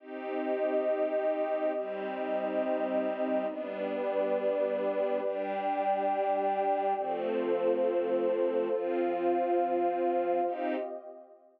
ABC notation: X:1
M:4/4
L:1/8
Q:1/4=69
K:Cdor
V:1 name="String Ensemble 1"
[CEG]4 [G,CG]4 | [G,=B,D]4 [G,DG]4 | [F,A,C]4 [F,CF]4 | [CEG]2 z6 |]
V:2 name="Pad 2 (warm)"
[CGe]4 [CEe]4 | [G=Bd]4 [Gdg]4 | [FAc]4 [Fcf]4 | [CGe]2 z6 |]